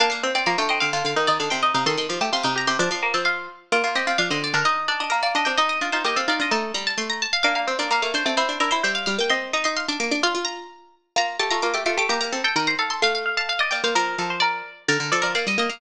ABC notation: X:1
M:2/2
L:1/8
Q:1/2=129
K:Bb
V:1 name="Pizzicato Strings"
f f2 d f g e f | f f2 d f g e f | c' c'2 a c' d' b c' | d' c'2 a f2 z2 |
d2 e d f e d B | e2 d e B d e g | e e2 c e f d e | a2 b a c' b a f |
f f2 d f f c d | c2 B c =e f f g | c'2 b c' c' d' d' d' | f2 b5 z |
b2 a b d' d' d' d' | b b2 g b b f c' | f f2 a f e g f | B4 d4 |
B2 A B d e e f |]
V:2 name="Pizzicato Strings"
D2 C C B, A, C C | F2 E E D C E E | A2 G G F E G G | D2 B, C F3 z |
F F G F D C2 D | E2 D D B, B, D D | E2 F F G A F F | E6 z2 |
B, B, C B, B, A,2 A, | =E2 E E c3 z | e2 e e f3 z | F4 z4 |
B,2 A, A, B, A, A, A, | G2 A A B c A A | f2 f f f d d c | B2 A c B3 z |
d2 d d f3 z |]
V:3 name="Pizzicato Strings"
B, B, C C F, D,2 D, | D, D, E, E, D, C,2 C, | E, E, F, A, C, C,2 C, | F, F,2 F,3 z2 |
B, B, C C F, D,2 D, | E6 D C | E2 D E B, C E D | A,2 G,2 A,3 z |
D2 C D B, B, D C | C D D =E G,2 G, B, | C2 E E2 D B, D | F F3 z4 |
F2 G F F G F G | B, B, C z E,2 z2 | A,6 B, B, | F,2 F,4 z2 |
D, D, F, F, B, G, B, B, |]